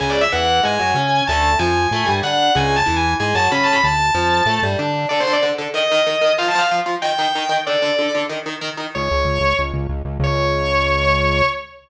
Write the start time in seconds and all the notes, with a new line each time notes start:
0.00 C#2 C#3 G#3 G#5
0.10 D5
0.21 E5
0.32 E2 E3 F#5
0.63 G#2 G#3 G#5
0.79 F#2 F#3
0.94 C#3 C#4
1.27 D2 D3 A3 A5
1.59 F2 F3 G#5
1.91 A2 A3
2.06 G2 G3
2.23 D3 D4 F#5
2.55 C#2 C#3 G#3 G#5
2.76 A5
2.86 E2 E3
2.96 G#5
3.20 G#2 G#3 G#5
3.35 F#2 F#3 A5
3.52 C#3 C#4 B5
3.63 A5
3.72 B5
3.84 D2 A5
4.15 F2 F3
4.46 A2 A3
4.63 G2 G3
4.79 D3 D4
5.09 D3 D4 A4 D5
5.20 C5
5.27 D3 D4 A4
5.33 D5
5.43 D3 D4 A4
5.58 D3 D4 A4
5.74 D#3 D#4 A#4 D#5
5.92 D#3 D#4 A#4
6.07 D#3 D#4 A#4
6.21 D#3 D#4 A#4
6.38 F3 F4 C5 F5
6.48 A5
6.55 F3 F4 C5 F5
6.71 F3 F4 C5
6.86 F3 F4 C5
7.02 D#3 D#4 A#4 G5
7.19 D#3 D#4 A#4
7.35 D#3 D#4 A#4
7.49 D#3 D#4 A#4
7.67 D3 D4 A4 D5
7.82 D3 D4 A4
7.99 D3 D4 A4
8.15 D3 D4 A4
8.29 D#3 D#4 A#4
8.46 D#3 D#4 A#4
8.61 D#3 D#4 A#4
8.77 D#3 D#4 A#4
8.95 C#2 C#5
9.11 C#2
9.25 C#2
9.40 C#2
9.59 C#2
9.74 C#2
9.89 C#2
10.05 C#2
10.20 C#2 C#5